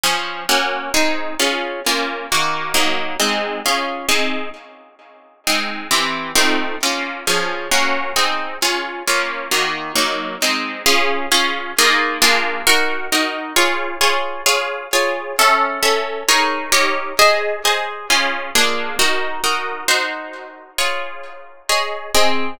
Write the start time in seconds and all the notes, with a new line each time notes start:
0.03 F3 C#4 G#4
0.49 A#3 C#4 F#4
0.94 C4 D#4 G#4
1.39 C#4 F4 G#4
1.86 A#3 C#4 F4
2.32 D#3 A#3 F#4
2.74 F#3 A#3 D#4
3.20 G#3 C4 D#4
3.66 C#4 F4 G#4
4.09 C4 D#4 G#4
5.47 G#3 C4 D#4
5.91 E3 C4 G4
6.35 A3 C4 D#4 F4
6.83 A#3 C#4 F4
7.27 F3 C#4 G#4
7.71 A#3 C#4 F#4
8.16 C4 D#4 G#4
8.62 C#4 F4 G#4
9.07 A#3 C#4 F4
9.51 D#3 A#3 F#4
9.95 F#3 A#3 D#4
10.42 G#3 C4 D#4
10.86 C#4 F4 G#4
11.32 C#4 F4 G#4
11.78 A#3 D#4 F4 G#4
12.22 A#3 D4 F4 G#4
12.67 D#4 F#4 A#4
13.12 D#4 F#4 A#4
13.56 F4 G#4 C#5
14.01 F4 G#4 C#5
14.46 F4 G#4 C#5
14.93 F4 G#4 C#5
15.39 C#4 A4 E5
15.83 C#4 A4 E5
16.28 D#4 G#4 A#4 C#5
16.72 D#4 G4 A#4 C#5
17.19 G#4 C5 D#5
17.65 G#4 C5 D#5
18.10 C#4 F4 G#4
18.55 A#3 D4 F4 G#4
18.99 D#4 F#4 A#4
19.44 D#4 F#4 A#4
19.88 D#4 F#4 C5
20.78 F4 G#4 C#5
21.69 G#4 C#5 D#5
22.14 C4 G#4 D#5